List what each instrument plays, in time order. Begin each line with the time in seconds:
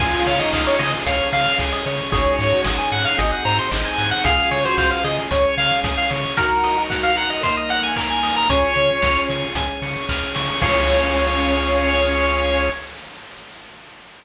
0.00 synth bass 1 C#2, drawbar organ C#4 F4 G#4, lead 1 (square) F4 G#4 G#5, kick, crash
0.26 synth bass 1 C#3, lead 1 (square) C#5 F5, open hi-hat
0.39 lead 1 (square) D#4 D#5
0.53 synth bass 1 C#2, lead 1 (square) D#5 F5, kick, clap
0.67 lead 1 (square) C#5
0.79 synth bass 1 C#3, lead 1 (square) G#4 D#5, open hi-hat
1.06 synth bass 1 C#2, drawbar organ C#4 G#4 C#5, lead 1 (square) C#5 F5, kick, closed hi-hat
1.32 synth bass 1 C#3, lead 1 (square) F5, open hi-hat
1.58 synth bass 1 C#2, lead 1 (square) G#4, kick, clap
1.72 lead 1 (square) D#5
1.86 synth bass 1 C#3, lead 1 (square) C#5, snare, open hi-hat
2.12 synth bass 1 G#1, drawbar organ C#4 D#4 F#4 G#4, lead 1 (square) G#4 C#5, kick, closed hi-hat
2.39 synth bass 1 G#2, lead 1 (square) C#5, open hi-hat
2.52 lead 1 (square) F#4
2.64 synth bass 1 G#1, drawbar organ C#4 D#4 G#4 C#5, lead 1 (square) D#5, kick, snare
2.78 lead 1 (square) G#5
2.92 synth bass 1 G#2, lead 1 (square) F#5, open hi-hat
3.05 lead 1 (square) F5
3.17 synth bass 1 G#1, drawbar organ C4 D#4 F#4 G#4, lead 1 (square) G#4 D#5, kick, closed hi-hat
3.32 lead 1 (square) F#5
3.45 synth bass 1 G#2, lead 1 (square) C5 A#5, open hi-hat
3.59 lead 1 (square) C6
3.71 synth bass 1 G#1, drawbar organ C4 D#4 G#4 C5, lead 1 (square) D#5, kick, clap
3.85 lead 1 (square) G#5
3.98 synth bass 1 G#2, lead 1 (square) F#5, snare, open hi-hat
4.11 lead 1 (square) F#5
4.24 synth bass 1 C#2, drawbar organ C#4 F4 G#4, lead 1 (square) G#4 F5, kick, closed hi-hat
4.51 synth bass 1 C#3, lead 1 (square) C#5, open hi-hat
4.64 lead 1 (square) F#4 C5
4.78 synth bass 1 C#2, lead 1 (square) C5 F5, kick, clap
4.91 lead 1 (square) F5
5.04 synth bass 1 C#3, lead 1 (square) G#4 D#5, open hi-hat
5.31 synth bass 1 C#2, drawbar organ C#4 G#4 C#5, lead 1 (square) C#5, kick, closed hi-hat
5.57 synth bass 1 C#3, lead 1 (square) F5, open hi-hat
5.84 synth bass 1 C#2, lead 1 (square) G#4, kick, snare
5.97 lead 1 (square) F5
6.10 synth bass 1 C#3, lead 1 (square) C#5, snare, open hi-hat
6.37 drawbar organ D#4 F#4 A#4, lead 1 (square) F#4 A#4, kick, closed hi-hat
6.63 lead 1 (square) D#5, open hi-hat
6.78 lead 1 (square) F#4
6.90 lead 1 (square) F#5, kick, snare
7.03 lead 1 (square) F5
7.16 lead 1 (square) A#4 F#5, open hi-hat
7.30 lead 1 (square) D#5
7.43 drawbar organ A#3 D#4 A#4, lead 1 (square) C5 D#5, kick, closed hi-hat
7.57 lead 1 (square) D#5
7.69 lead 1 (square) F#5, open hi-hat
7.83 lead 1 (square) G#5
7.96 lead 1 (square) A#4, kick, clap
8.10 lead 1 (square) G#5
8.23 lead 1 (square) D#5, snare, open hi-hat
8.36 lead 1 (square) A#5
8.49 synth bass 1 C#2, lead 1 (square) C#4 C#5 G#5, drawbar organ C#4 F4 G#4, kick, closed hi-hat
8.76 synth bass 1 C#3, lead 1 (square) C#6, closed hi-hat
9.02 synth bass 1 C#2, lead 1 (square) F6, kick, snare
9.29 synth bass 1 C#3, lead 1 (square) C#6, open hi-hat
9.55 synth bass 1 C#2, drawbar organ C#4 G#4 C#5, lead 1 (square) G#5, kick, closed hi-hat
9.82 synth bass 1 C#3, lead 1 (square) C#6, open hi-hat
10.09 synth bass 1 C#2, lead 1 (square) F6, kick, clap
10.35 synth bass 1 C#3, lead 1 (square) C#6, snare, open hi-hat
10.62 synth bass 1 C#2, lead 1 (square) C#4 G#4 C#5 F5, drawbar organ C#4 F4 G#4, kick, crash